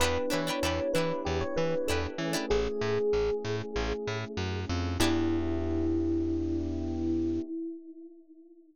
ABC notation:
X:1
M:4/4
L:1/16
Q:1/4=96
K:Edor
V:1 name="Electric Piano 1"
B2 c4 B2 G c B2 A z3 | ^G10 z6 | E16 |]
V:2 name="Pizzicato Strings"
[DEGB]2 [DEGB] [DEGB] [DEGB]2 [DEGB]6 [DEGB]3 [DEGB] | z16 | [DEGB]16 |]
V:3 name="Electric Piano 1"
[B,DEG]14 [A,CE^G]2- | [A,CE^G]16 | [B,DEG]16 |]
V:4 name="Electric Bass (finger)" clef=bass
E,,2 E,2 E,,2 E,2 E,,2 E,2 E,,2 E,2 | A,,,2 A,,2 A,,,2 A,,2 A,,,2 A,,2 F,,2 =F,,2 | E,,16 |]